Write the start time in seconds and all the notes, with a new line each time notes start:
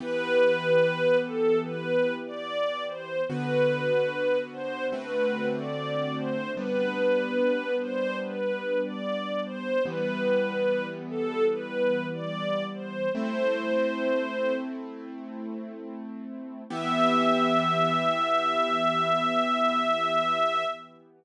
0.00 E3 B3 G4 B4
1.23 A4
1.64 B4
2.26 D5
2.88 C5
3.29 D3 B3 F#4 B4
4.52 C5
4.92 D3 A3 C4 F#4 B4
5.55 D5
6.16 C5
6.57 G3 B3 D4 B4
7.81 C5
8.22 B4
8.84 D5
9.45 C5
9.85 E3 G3 B3 B4
11.10 A4
11.51 B4
12.12 D5
12.74 C5
13.15 A3 C4 E4 C5
16.70 E3 B3 G4 E5